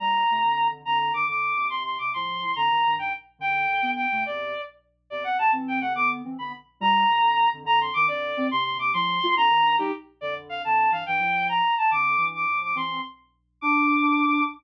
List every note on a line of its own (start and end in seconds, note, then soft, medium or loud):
0.00 0.23 A#2 medium
0.00 0.23 G3 medium
0.00 0.67 A#5 medium
0.30 0.42 C3 medium
0.30 0.42 A3 medium
0.44 0.68 F2 medium
0.44 0.68 D3 medium
0.71 0.83 F2 medium
0.71 0.83 D3 medium
0.85 1.11 F2 medium
0.85 1.11 D3 medium
0.85 0.98 A#5 medium
0.99 1.13 A#5 medium
1.12 1.24 G2 medium
1.12 1.24 D#3 medium
1.12 1.26 D6 medium
1.28 1.52 F2 medium
1.28 1.52 D3 medium
1.28 1.67 D6 medium
1.55 1.68 D#2 medium
1.55 1.68 C3 medium
1.69 1.96 D#2 medium
1.69 1.96 C3 medium
1.69 1.83 C6 medium
1.85 1.98 C6 medium
1.98 2.13 D#2 medium
1.98 2.13 C3 medium
1.98 2.10 D6 medium
2.13 2.40 A2 medium
2.13 2.40 F3 medium
2.13 2.55 C6 medium
2.41 2.53 A2 medium
2.41 2.53 F3 medium
2.56 2.68 F2 medium
2.56 2.68 D3 medium
2.56 2.95 A#5 medium
2.70 2.82 G2 medium
2.70 2.82 D#3 medium
2.86 2.97 G2 medium
2.86 2.97 D#3 medium
2.98 3.10 G2 medium
2.98 3.10 D#3 medium
2.98 3.13 G5 medium
3.39 3.66 F#2 medium
3.39 3.66 D3 medium
3.39 3.91 G5 loud
3.68 3.80 F#2 medium
3.68 3.80 D3 medium
3.82 4.06 D3 medium
3.82 4.06 B3 medium
3.96 4.24 G5 medium
4.12 4.24 C3 medium
4.12 4.24 A3 medium
4.26 4.54 E2 medium
4.26 4.54 C3 medium
4.26 4.62 D5 medium
5.10 5.36 E2 medium
5.10 5.36 C3 medium
5.10 5.23 D5 medium
5.24 5.37 F#5 medium
5.38 5.50 E2 medium
5.38 5.50 C3 medium
5.38 5.51 A5 medium
5.52 5.80 E3 medium
5.52 5.80 C4 medium
5.68 5.79 G5 medium
5.81 5.94 C3 medium
5.81 5.94 A3 medium
5.81 5.93 F#5 medium
5.95 6.22 D3 medium
5.95 6.22 B3 medium
5.95 6.09 D6 loud
6.25 6.36 E3 medium
6.25 6.36 C4 medium
6.39 6.52 D3 medium
6.39 6.52 B3 medium
6.39 6.52 B5 medium
6.80 7.05 A#2 loud
6.80 7.05 G3 loud
6.80 7.49 A#5 loud
7.08 7.20 C3 medium
7.08 7.20 A3 medium
7.21 7.46 F2 medium
7.21 7.46 D3 medium
7.53 7.63 F2 medium
7.53 7.63 D3 medium
7.64 7.89 F2 medium
7.64 7.89 D3 loud
7.64 7.79 A#5 loud
7.81 7.94 C6 medium
7.94 8.07 G2 medium
7.94 8.07 D#3 medium
7.94 8.06 D6 loud
8.07 8.32 F2 medium
8.07 8.32 D3 medium
8.07 8.47 D5 loud
8.37 8.49 D#3 medium
8.37 8.49 C4 medium
8.51 8.77 D#2 medium
8.51 8.77 C3 loud
8.51 8.64 C6 loud
8.64 8.78 C6 loud
8.78 8.92 D#2 medium
8.78 8.92 C3 medium
8.78 8.91 D6 medium
8.94 9.19 A2 medium
8.94 9.19 F3 loud
8.94 9.35 C6 loud
9.23 9.35 A3 medium
9.23 9.35 F4 medium
9.36 9.48 F2 loud
9.36 9.48 D3 loud
9.36 9.76 A#5 loud
9.50 9.62 G2 medium
9.50 9.62 D#3 medium
9.62 9.76 G2 medium
9.62 9.76 D#3 medium
9.78 9.91 G3 medium
9.78 9.91 D#4 loud
9.78 9.92 G4 loud
10.21 10.63 F2 medium
10.21 10.63 D3 medium
10.21 10.34 D5 loud
10.49 10.62 F5 medium
10.64 10.88 F2 medium
10.64 10.88 D3 medium
10.64 10.91 A5 medium
10.91 11.03 G2 medium
10.91 11.03 E3 medium
10.91 11.04 F5 medium
11.06 11.20 G2 medium
11.06 11.20 E3 medium
11.06 11.47 G5 loud
11.20 11.61 A2 medium
11.20 11.61 F3 medium
11.49 11.75 A#5 medium
11.78 11.90 A5 medium
11.91 12.15 F2 medium
11.91 12.15 D3 medium
11.91 12.26 D6 loud
12.18 12.45 G2 medium
12.18 12.45 E3 medium
12.35 12.59 D6 medium
12.49 12.72 A2 medium
12.49 12.72 F3 medium
12.63 12.75 D6 medium
12.75 12.99 E3 medium
12.75 12.99 C4 medium
12.75 13.01 C6 medium
13.61 14.44 D4 loud
13.61 14.43 D6 loud